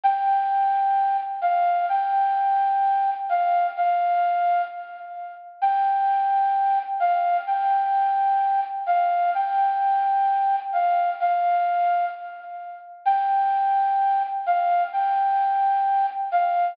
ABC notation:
X:1
M:4/4
L:1/8
Q:1/4=129
K:Gdor
V:1 name="Flute"
g6 f2 | g6 f2 | f4 z4 | g6 f2 |
g6 f2 | g6 f2 | f4 z4 | g6 f2 |
g6 f2 |]